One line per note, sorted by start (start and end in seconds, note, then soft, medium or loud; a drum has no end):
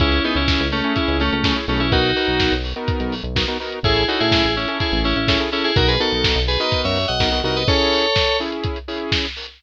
0.00 0.21 C#2 loud
0.00 0.19 C#4 medium
0.00 0.23 C#4 medium
0.00 0.19 E4 medium
0.00 0.23 E4 loud
0.00 0.19 G#4 medium
0.00 kick loud
0.00 closed hi-hat loud
0.12 closed hi-hat medium
0.24 0.35 B3 medium
0.24 0.62 C#4 medium
0.24 0.35 D#4 medium
0.24 0.62 E4 medium
0.24 0.62 G#4 medium
0.24 open hi-hat medium
0.35 0.57 C#2 medium
0.35 0.67 C#4 medium
0.35 0.67 E4 medium
0.35 closed hi-hat medium
0.48 kick loud
0.48 snare loud
0.60 0.82 C#2 medium
0.60 closed hi-hat medium
0.72 0.93 A3 medium
0.72 0.93 C#4 medium
0.72 open hi-hat medium
0.84 1.22 C#4 medium
0.84 1.22 E4 medium
0.84 1.22 G#4 medium
0.84 closed hi-hat medium
0.96 1.17 C#4 medium
0.96 1.17 E4 medium
0.96 kick medium
0.96 closed hi-hat loud
1.08 1.30 C#2 medium
1.08 closed hi-hat medium
1.20 1.31 A3 medium
1.20 1.31 C#4 medium
1.20 open hi-hat medium
1.32 1.54 C#2 medium
1.32 1.44 A3 medium
1.32 1.44 C#4 medium
1.32 closed hi-hat medium
1.44 1.56 A3 medium
1.44 1.54 C#4 medium
1.44 1.56 C#4 medium
1.44 1.54 E4 medium
1.44 1.54 G#4 medium
1.44 kick loud
1.44 snare loud
1.56 1.66 C#4 medium
1.56 1.66 E4 medium
1.56 1.66 G#4 medium
1.56 closed hi-hat medium
1.68 2.14 B1 loud
1.68 1.80 A3 medium
1.68 1.79 C#4 medium
1.68 1.87 C#4 medium
1.68 1.87 E4 medium
1.68 1.87 G#4 medium
1.68 open hi-hat medium
1.80 1.91 C#4 medium
1.80 1.91 E4 medium
1.80 closed hi-hat medium
1.92 2.11 B3 medium
1.92 2.11 D#4 medium
1.92 2.53 D#4 medium
1.92 2.11 F#4 medium
1.92 2.53 F#4 loud
1.92 2.11 A#4 medium
1.92 kick loud
1.92 closed hi-hat loud
2.04 closed hi-hat medium
2.16 2.54 B3 medium
2.16 2.54 D#4 medium
2.16 2.54 F#4 medium
2.16 2.54 A#4 medium
2.16 open hi-hat medium
2.28 2.49 B1 medium
2.28 closed hi-hat medium
2.40 kick medium
2.40 snare loud
2.52 2.73 B1 medium
2.52 closed hi-hat medium
2.64 open hi-hat medium
2.76 3.14 B3 medium
2.76 3.14 D#4 medium
2.76 3.14 F#4 soft
2.76 3.14 A#4 medium
2.76 closed hi-hat medium
2.88 kick loud
2.88 closed hi-hat loud
3.00 3.22 B1 medium
3.00 closed hi-hat medium
3.12 open hi-hat medium
3.23 3.45 B1 medium
3.23 closed hi-hat medium
3.36 3.46 B3 medium
3.36 3.46 D#4 medium
3.36 3.46 F#4 medium
3.36 3.46 A#4 medium
3.36 kick medium
3.36 snare loud
3.48 3.58 B3 medium
3.48 3.58 D#4 medium
3.48 3.58 F#4 medium
3.48 3.58 A#4 medium
3.48 closed hi-hat medium
3.60 3.79 B3 medium
3.60 3.79 D#4 medium
3.60 3.79 F#4 medium
3.60 3.79 A#4 medium
3.60 open hi-hat medium
3.72 closed hi-hat medium
3.83 4.05 A1 loud
3.83 4.03 C#4 medium
3.83 4.03 E4 medium
3.83 4.05 E4 medium
3.83 4.03 G#4 medium
3.83 4.05 G#4 loud
3.83 4.03 A4 medium
3.83 kick loud
3.83 closed hi-hat loud
3.96 closed hi-hat medium
4.08 4.46 C#4 medium
4.08 4.19 D#4 medium
4.08 4.46 E4 medium
4.08 4.19 F#4 medium
4.08 4.46 G#4 medium
4.08 4.46 A4 medium
4.08 open hi-hat medium
4.20 4.42 A2 medium
4.20 4.54 E4 medium
4.20 4.54 G#4 medium
4.20 closed hi-hat medium
4.32 kick medium
4.32 snare loud
4.44 4.66 A1 medium
4.44 closed hi-hat medium
4.56 4.77 C#4 medium
4.56 4.77 E4 medium
4.56 open hi-hat medium
4.68 5.07 C#4 medium
4.68 5.07 E4 medium
4.68 5.07 G#4 medium
4.68 5.07 A4 medium
4.68 closed hi-hat medium
4.80 5.00 E4 medium
4.80 5.00 G#4 medium
4.80 kick medium
4.80 closed hi-hat loud
4.92 5.14 A1 medium
4.92 closed hi-hat medium
5.04 5.16 C#4 medium
5.04 5.16 E4 medium
5.04 open hi-hat medium
5.16 5.38 A1 medium
5.16 5.28 C#4 medium
5.16 5.28 E4 medium
5.16 closed hi-hat medium
5.28 5.38 C#4 medium
5.28 5.39 C#4 medium
5.28 5.38 E4 medium
5.28 5.39 E4 medium
5.28 5.38 G#4 medium
5.28 5.38 A4 medium
5.28 kick loud
5.28 snare loud
5.40 5.50 C#4 medium
5.40 5.50 E4 medium
5.40 5.50 G#4 medium
5.40 5.50 A4 medium
5.40 closed hi-hat medium
5.52 5.71 C#4 medium
5.52 5.63 C#4 medium
5.52 5.71 E4 medium
5.52 5.63 E4 medium
5.52 5.71 G#4 medium
5.52 5.71 A4 medium
5.52 open hi-hat medium
5.64 5.75 E4 medium
5.64 5.75 G#4 medium
5.64 closed hi-hat medium
5.76 5.98 B1 loud
5.76 5.95 B3 medium
5.76 5.95 D#4 medium
5.76 5.95 F#4 medium
5.76 5.88 F#4 medium
5.76 5.95 A#4 medium
5.76 5.88 A#4 medium
5.76 kick loud
5.76 closed hi-hat loud
5.88 5.99 G#4 medium
5.88 5.99 B4 medium
5.88 closed hi-hat medium
6.00 6.38 B3 medium
6.00 6.38 D#4 medium
6.00 6.38 F#4 medium
6.00 6.40 A4 loud
6.00 6.38 A#4 medium
6.00 open hi-hat medium
6.12 6.34 B1 medium
6.12 closed hi-hat medium
6.24 kick medium
6.24 snare loud
6.36 6.57 B1 medium
6.36 closed hi-hat medium
6.48 6.59 G#4 medium
6.48 6.59 B4 medium
6.48 open hi-hat medium
6.60 6.98 B3 medium
6.60 6.98 D#4 medium
6.60 6.98 F#4 medium
6.60 6.98 A#4 medium
6.60 6.81 B4 medium
6.60 6.81 D#5 medium
6.60 closed hi-hat medium
6.72 kick loud
6.72 closed hi-hat loud
6.84 7.06 F#2 medium
6.84 7.06 C#5 medium
6.84 7.06 E5 medium
6.84 closed hi-hat medium
6.96 open hi-hat medium
7.08 7.20 B1 medium
7.08 7.39 D#5 medium
7.08 7.39 F#5 medium
7.08 closed hi-hat medium
7.20 7.42 B1 medium
7.20 7.30 B3 medium
7.20 7.30 D#4 medium
7.20 7.30 F#4 medium
7.20 7.30 A#4 medium
7.20 kick medium
7.20 snare loud
7.32 7.42 B3 medium
7.32 7.42 D#4 medium
7.32 7.42 F#4 medium
7.32 7.42 A#4 medium
7.32 closed hi-hat medium
7.44 7.65 C2 medium
7.44 7.63 B3 medium
7.44 7.63 D#4 medium
7.44 7.63 F#4 medium
7.44 7.63 A#4 medium
7.44 7.55 D#5 medium
7.44 7.56 F#5 medium
7.44 open hi-hat medium
7.56 7.67 B4 medium
7.56 7.67 D#5 medium
7.56 closed hi-hat medium
7.68 8.06 C#4 medium
7.68 8.06 E4 medium
7.68 8.06 G#4 medium
7.68 8.37 A4 medium
7.68 8.37 C#5 loud
7.68 kick loud
7.68 closed hi-hat loud
7.80 closed hi-hat medium
7.92 open hi-hat loud
8.04 closed hi-hat medium
8.16 kick medium
8.16 snare loud
8.28 closed hi-hat medium
8.40 8.78 C#4 medium
8.40 8.78 E4 medium
8.40 8.78 G#4 medium
8.40 open hi-hat medium
8.52 closed hi-hat medium
8.63 kick loud
8.63 closed hi-hat loud
8.76 closed hi-hat medium
8.88 9.26 C#4 medium
8.88 9.26 E4 medium
8.88 9.26 G#4 medium
8.88 open hi-hat medium
9.00 closed hi-hat medium
9.12 kick medium
9.12 snare loud
9.24 closed hi-hat medium
9.36 open hi-hat loud
9.47 closed hi-hat medium